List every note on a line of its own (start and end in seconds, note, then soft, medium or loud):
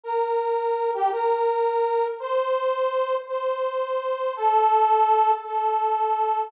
0.04 0.91 A#4 medium
0.94 1.11 G4 medium
1.12 2.06 A#4 medium
2.20 3.15 C5 loud
3.28 4.33 C5 medium
4.36 5.31 A4 loud
5.45 6.50 A4 medium